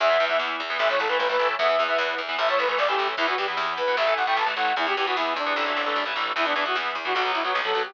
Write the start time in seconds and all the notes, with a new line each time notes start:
0.00 E2 E3 B3 E5, kick, closed hi-hat
0.10 E3 B3, kick
0.19 E2 E3 B3, kick, closed hi-hat
0.29 E3 B3 E5, kick
0.39 E2, kick, snare
0.50 kick
0.60 E2, kick, closed hi-hat
0.70 E3 B3, kick
0.79 A1 E3 A3 E5, kick, closed hi-hat
0.90 E3 A3 C#5, kick
0.99 A1 A4, kick, closed hi-hat
1.08 E3 A3 B4, kick
1.19 A1 B4, kick, snare
1.29 E3 A3 B4, kick
1.39 A1 E3 A3, kick, closed hi-hat
1.49 kick
1.58 E2 E3 B3 E5, kick, closed hi-hat
1.69 E3 B3, kick
1.78 E2 E3 B3, kick, closed hi-hat
1.88 E3 B3 E5, kick
1.98 E2, kick, snare
2.09 kick
2.18 E2, kick, closed hi-hat
2.28 E3 B3, kick
2.38 A1 E3 A3 E5, kick, closed hi-hat
2.48 E3 A3 C#5, kick
2.58 A1 B4, kick, closed hi-hat
2.68 E3 A3 B4, kick
2.78 A1 D5, kick, snare
2.88 E3 A3 G4, kick
2.98 A1 E3 A3, kick, closed hi-hat
3.08 kick
3.17 E2 E3 B3 E4, kick, closed hi-hat
3.28 E3 B3 F#4, kick
3.37 E2 E3 B3 G4, kick, closed hi-hat
3.48 E3 B3, kick
3.57 E2, kick, snare
3.68 kick
3.77 E2 B4, kick, closed hi-hat
3.87 E3 B3, kick
3.97 A1 E3 A3 E5, kick, closed hi-hat
4.07 E3 A3, kick
4.16 A1 F#5, kick, closed hi-hat
4.26 E3 A3 G5, kick
4.37 A1 A5, kick, snare
4.46 E3 A3, kick
4.56 A1 E3 A3 F#5, kick, closed hi-hat
4.67 kick
4.76 E2 E3 B3 E4, kick, closed hi-hat
4.86 E3 B3 G4, kick
4.97 E2 E3 B3 G4, kick, closed hi-hat
5.06 E3 B3 F#4, kick
5.16 E2 E4, kick, snare
5.26 kick
5.36 E2 D4, kick, closed hi-hat
5.46 E3 B3, kick
5.56 A1 E3 A3, kick
5.66 E3 A3
5.76 A1
5.86 E3 A3
5.96 A1, mid tom
6.06 E3 A3
6.15 A1 E3 A3, floor tom
6.36 E2 E3 B3 E4, kick, crash
6.45 E3 B3 D4, kick
6.55 E2 E3 B3 D4, kick, closed hi-hat
6.65 E3 B3 F#4, kick
6.75 E2, kick, snare
6.85 kick
6.95 E2, kick, closed hi-hat
7.05 E3 B3 F#4, kick
7.15 B1 F#3 B3 F#4, kick, closed hi-hat
7.25 F#3 B3, kick
7.34 B1 E4, kick, closed hi-hat
7.44 F#3 B3 F#4, kick
7.55 B1, kick, snare
7.64 F#3 B3 A4, kick
7.74 B1 F#3 B3, kick, closed hi-hat
7.85 G4, kick